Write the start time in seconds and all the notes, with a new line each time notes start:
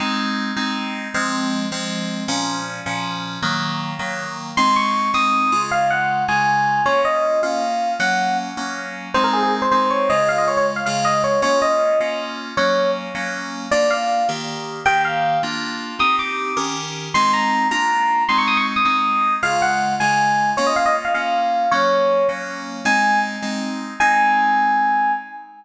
0.00 G#3 C4 D#4
0.56 G#3 C4 D#4
1.14 F3 G#3 C4
1.72 F3 G#3 C4
2.28 A#2 F3 C#4
2.86 A#2 F3 C#4
3.42 D#3 F#3 A#3
3.99 D#3 F#3 A#3
4.57 G#3 C4 D#4 C6
4.76 C#6
5.14 G#3 C4 D#4 D#6
5.52 C#3 G#3 F4
5.71 F5
5.90 F#5
6.28 C#3 G#3 F4 G#5
6.86 A#3 C#4 F4 C#5
7.05 D#5
7.43 A#3 C#4 F4 F5
8.00 F#3 A#3 C#4 F#5
8.57 F#3 A#3 C#4
9.14 G#3 C4 D#4 C5
9.24 A#4
9.33 G#4
9.43 G#4
9.62 C5
9.71 G#3 C4 D#4 C5
9.90 C#5
10.10 C#3 G#3 F4 D#5
10.29 F5
10.38 D#5
10.48 C#5
10.57 C#5
10.76 F5
10.86 C#3 G#3 F4 F5
11.05 D#5
11.24 C#5
11.42 A#3 C#4 F4 C#5
11.62 D#5
12.00 A#3 C#4 F4
12.57 F#3 A#3 C#4 C#5
13.15 F#3 A#3 C#4
13.71 A#3 D4 F4 D5
13.90 F5
14.29 D#3 A#3 G4
14.85 D#3 A#3 G4 G5
15.05 F5
15.43 A#3 D4 F4
15.99 C4 D#4 G4 D#6
16.19 D6
16.57 D#3 C#4 G4 A#4
17.14 G#3 C4 D#4 C6
17.33 A#5
17.71 A#3 D4 F4 A#5
18.29 G#3 C4 D#4 C6
18.38 C#6
18.48 D#6
18.57 C#6
18.76 D#6
18.85 G#3 C4 D#4 D#6
19.43 C#3 G#3 F4 F5
19.62 F#5
20.00 C#3 G#3 F4 G#5
20.57 A#3 C#4 F4 C#5
20.67 D#5
20.76 F5
20.86 D#5
21.05 F5
21.14 A#3 C#4 F4 F5
21.71 F#3 A#3 C#4 C#5
22.29 F#3 A#3 C#4
22.85 G#3 C4 D#4 G#5
23.42 G#3 C4 D#4
24.00 G#3 C4 D#4 G#5